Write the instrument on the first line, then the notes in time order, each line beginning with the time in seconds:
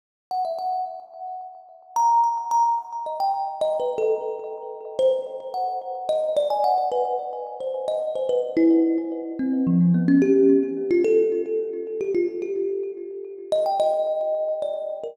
kalimba
0.31 F#5
0.45 E5
0.59 F#5
1.96 A#5
2.24 A#5
2.51 A#5
3.06 D#5
3.20 G5
3.61 D#5
3.80 B4
3.98 A4
4.99 C5
5.54 F#5
6.09 D#5
6.37 D5
6.50 G#5
6.64 F#5
6.92 B4
7.60 C5
7.88 D#5
8.15 C5
8.29 B4
8.57 E4
9.39 C4
9.67 F3
9.94 B3
10.08 C#4
10.22 G4
10.91 F4
11.04 A4
12.01 G4
12.15 F4
12.42 G4
13.52 D#5
13.66 G5
13.80 D#5
14.62 D5
15.04 A#4